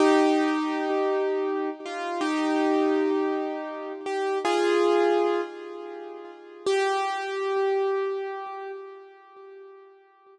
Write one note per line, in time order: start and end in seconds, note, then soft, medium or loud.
0.00 1.70 D#4 medium
0.00 1.70 G4 medium
1.85 2.20 F4 medium
2.21 3.92 D#4 medium
2.21 3.92 G4 medium
4.06 4.38 G4 medium
4.45 5.41 F4 medium
4.45 5.41 G#4 medium
6.67 8.71 G4 loud